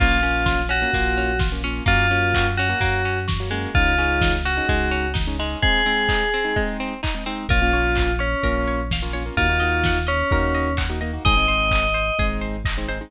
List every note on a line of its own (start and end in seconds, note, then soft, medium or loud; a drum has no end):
0.00 0.85 A#1 loud
0.00 0.19 A#3 medium
0.00 0.21 A#3 medium
0.00 0.19 C#4 medium
0.00 0.19 F4 loud
0.00 0.60 F4 medium
0.00 kick loud
0.00 crash loud
0.23 0.61 A#3 medium
0.23 0.44 C#4 medium
0.23 0.61 C#4 medium
0.23 0.61 F4 medium
0.23 open hi-hat medium
0.46 0.67 F4 medium
0.46 kick medium
0.46 snare loud
0.69 0.90 C#4 medium
0.69 1.39 F#4 medium
0.69 open hi-hat loud
0.82 0.91 A#3 medium
0.82 0.91 C#4 medium
0.82 0.91 F4 medium
0.94 1.81 A#1 medium
0.94 1.32 A#3 medium
0.94 1.15 A#3 medium
0.94 1.32 C#4 medium
0.94 1.32 F4 medium
0.94 kick medium
0.94 closed hi-hat loud
1.16 1.39 C#4 medium
1.16 open hi-hat medium
1.39 1.61 F4 medium
1.39 kick loud
1.39 snare loud
1.52 1.62 A#3 medium
1.52 1.62 C#4 medium
1.52 1.62 F4 medium
1.64 1.83 A#3 medium
1.64 1.83 C#4 medium
1.64 1.85 C#4 medium
1.64 1.83 F4 medium
1.64 open hi-hat medium
1.86 2.74 F#2 loud
1.86 2.07 A#3 medium
1.86 2.06 A#3 medium
1.86 2.06 C#4 medium
1.86 2.46 F4 medium
1.86 2.06 F#4 medium
1.86 kick loud
1.86 closed hi-hat loud
2.10 2.48 A#3 medium
2.10 2.32 C#4 medium
2.10 2.48 C#4 medium
2.10 2.48 F#4 medium
2.10 open hi-hat loud
2.34 2.57 F#4 medium
2.34 kick medium
2.34 clap loud
2.57 2.80 C#4 medium
2.57 3.18 F#4 medium
2.57 open hi-hat medium
2.69 2.79 A#3 medium
2.69 2.79 C#4 medium
2.69 2.79 F#4 medium
2.80 3.67 F#2 medium
2.80 3.02 A#3 medium
2.80 3.19 A#3 medium
2.80 3.19 C#4 medium
2.80 3.19 F#4 medium
2.80 kick medium
2.80 closed hi-hat loud
3.05 3.26 C#4 medium
3.05 open hi-hat medium
3.28 3.49 F#4 medium
3.28 kick medium
3.28 snare loud
3.40 3.49 A#3 medium
3.40 3.49 C#4 medium
3.40 3.49 F#4 medium
3.51 3.95 G#3 medium
3.51 3.70 A#3 medium
3.51 3.70 C#4 medium
3.51 3.70 F#4 medium
3.51 open hi-hat medium
3.74 4.61 C#2 loud
3.74 3.94 G#3 medium
3.74 3.94 C#4 medium
3.74 3.94 D#4 medium
3.74 4.32 F4 medium
3.74 kick loud
3.74 closed hi-hat loud
3.98 4.36 G#3 medium
3.98 4.19 C#4 medium
3.98 4.36 C#4 medium
3.98 4.36 D#4 medium
3.98 open hi-hat medium
4.21 4.42 D#4 medium
4.21 kick loud
4.21 snare loud
4.44 4.66 C#4 medium
4.44 5.08 F#4 medium
4.44 open hi-hat medium
4.57 4.66 G#3 medium
4.57 4.66 C#4 medium
4.57 4.66 D#4 medium
4.69 5.55 C#2 medium
4.69 5.06 G#3 medium
4.69 4.90 G#3 medium
4.69 5.06 C#4 medium
4.69 5.06 D#4 medium
4.69 kick medium
4.69 closed hi-hat loud
4.91 5.12 C#4 medium
4.91 open hi-hat medium
5.14 5.35 D#4 medium
5.14 kick loud
5.14 snare loud
5.27 5.37 G#3 medium
5.27 5.37 C#4 medium
5.27 5.37 D#4 medium
5.39 5.58 G#3 medium
5.39 5.84 G#3 medium
5.39 5.58 C#4 medium
5.39 5.58 D#4 medium
5.39 open hi-hat medium
5.62 5.81 G#3 medium
5.62 5.81 C4 medium
5.62 5.81 D#4 medium
5.62 6.60 G#4 medium
5.62 kick loud
5.62 closed hi-hat loud
5.85 6.23 G#3 medium
5.85 6.07 C4 medium
5.85 6.23 C4 medium
5.85 6.23 D#4 medium
5.85 open hi-hat medium
6.09 6.30 D#4 medium
6.09 kick medium
6.09 clap loud
6.34 6.55 C4 medium
6.34 open hi-hat medium
6.45 6.54 G#3 medium
6.45 6.54 C4 medium
6.45 6.54 D#4 medium
6.56 6.93 G#3 medium
6.56 6.77 G#3 medium
6.56 6.93 C4 medium
6.56 6.93 D#4 medium
6.56 kick medium
6.56 closed hi-hat loud
6.80 7.01 C4 medium
6.80 open hi-hat medium
7.03 7.24 D#4 medium
7.03 kick medium
7.03 clap loud
7.15 7.24 G#3 medium
7.15 7.24 C4 medium
7.15 7.24 D#4 medium
7.26 7.45 G#3 medium
7.26 7.47 C4 medium
7.26 7.45 C4 medium
7.26 7.45 D#4 medium
7.26 open hi-hat medium
7.49 8.35 A#1 loud
7.49 7.59 A#3 medium
7.49 7.59 C#4 medium
7.49 7.59 F4 medium
7.49 8.12 F4 medium
7.49 7.70 A#4 medium
7.49 kick loud
7.49 closed hi-hat loud
7.62 7.71 A#3 medium
7.62 7.71 C#4 medium
7.62 7.71 F4 medium
7.73 8.11 A#3 medium
7.73 8.11 C#4 medium
7.73 8.11 F4 medium
7.73 7.94 C#5 medium
7.73 open hi-hat medium
7.95 8.19 F5 medium
7.95 kick medium
7.95 clap loud
8.19 8.80 C#4 medium
8.19 8.40 C#5 medium
8.19 open hi-hat medium
8.43 9.30 A#1 medium
8.43 8.81 A#3 medium
8.43 8.81 C#4 medium
8.43 8.81 F4 medium
8.43 8.65 A#4 medium
8.43 kick medium
8.43 closed hi-hat loud
8.68 8.89 C#5 medium
8.68 open hi-hat medium
8.91 9.14 F5 medium
8.91 kick medium
8.91 snare loud
9.02 9.12 A#3 medium
9.02 9.12 C#4 medium
9.02 9.12 F4 medium
9.13 9.23 A#3 medium
9.13 9.23 C#4 medium
9.13 9.23 F4 medium
9.13 9.34 C#5 medium
9.13 open hi-hat medium
9.26 9.35 A#3 medium
9.26 9.35 C#4 medium
9.26 9.35 F4 medium
9.37 10.23 D#2 loud
9.37 9.47 A#3 medium
9.37 9.47 D#4 medium
9.37 9.97 F4 medium
9.37 9.47 F#4 medium
9.37 9.58 A#4 medium
9.37 kick medium
9.37 closed hi-hat loud
9.49 9.58 A#3 medium
9.49 9.58 D#4 medium
9.49 9.58 F#4 medium
9.60 9.99 A#3 medium
9.60 9.99 D#4 medium
9.60 9.99 F#4 medium
9.60 9.81 D#5 medium
9.60 open hi-hat medium
9.84 10.07 F#5 medium
9.84 kick medium
9.84 snare loud
10.07 10.73 C#4 medium
10.07 10.28 D#5 medium
10.07 open hi-hat medium
10.30 11.19 D#2 medium
10.30 10.69 A#3 medium
10.30 10.69 D#4 medium
10.30 10.69 F#4 medium
10.30 10.53 A#4 medium
10.30 kick loud
10.30 closed hi-hat loud
10.54 10.76 D#5 medium
10.54 open hi-hat medium
10.77 10.99 F#5 medium
10.77 kick medium
10.77 clap loud
10.90 10.99 A#3 medium
10.90 10.99 D#4 medium
10.90 10.99 F#4 medium
11.01 11.11 A#3 medium
11.01 11.11 D#4 medium
11.01 11.11 F#4 medium
11.01 11.22 D#5 medium
11.01 open hi-hat medium
11.13 11.23 A#3 medium
11.13 11.23 D#4 medium
11.13 11.23 F#4 medium
11.25 12.11 G#1 medium
11.25 11.34 G#3 medium
11.25 11.34 C4 medium
11.25 11.34 D#4 medium
11.25 11.47 G#4 medium
11.25 12.25 D#5 medium
11.25 kick loud
11.25 closed hi-hat loud
11.37 11.46 G#3 medium
11.37 11.46 C4 medium
11.37 11.46 D#4 medium
11.48 11.86 G#3 medium
11.48 11.86 C4 medium
11.48 11.86 D#4 medium
11.48 11.69 C5 medium
11.48 open hi-hat medium
11.71 11.94 D#5 medium
11.71 kick medium
11.71 clap loud
11.94 12.15 C5 medium
11.94 open hi-hat medium
12.19 13.05 G#1 medium
12.19 12.56 G#3 medium
12.19 12.56 C4 medium
12.19 12.56 D#4 medium
12.19 12.40 G#4 medium
12.19 kick loud
12.19 closed hi-hat loud
12.41 12.62 C5 medium
12.41 open hi-hat medium
12.65 12.87 D#5 medium
12.65 kick loud
12.65 clap loud
12.78 12.87 G#3 medium
12.78 12.87 C4 medium
12.78 12.87 D#4 medium
12.88 12.98 G#3 medium
12.88 12.98 C4 medium
12.88 12.98 D#4 medium
12.88 13.10 C5 medium
12.88 open hi-hat medium
13.01 13.10 G#3 medium
13.01 13.10 C4 medium
13.01 13.10 D#4 medium